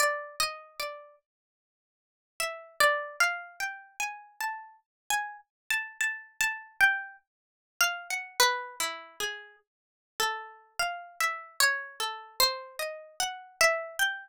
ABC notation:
X:1
M:6/4
L:1/16
Q:1/4=50
K:none
V:1 name="Pizzicato Strings"
(3d2 _e2 d2 z4 (3=e2 d2 f2 (3g2 _a2 =a2 z _a z =a (3a2 a2 g2 | z2 f _g (3B2 E2 _A2 z2 =A2 (3f2 e2 _d2 (3A2 c2 _e2 (3g2 =e2 =g2 |]